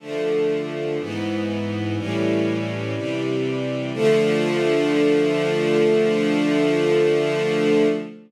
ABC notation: X:1
M:4/4
L:1/8
Q:1/4=61
K:Dm
V:1 name="String Ensemble 1"
[D,F,A,]2 [^G,,E,=B,]2 [A,,E,=G,^C]2 [=C,E,G,]2 | [D,F,A,]8 |]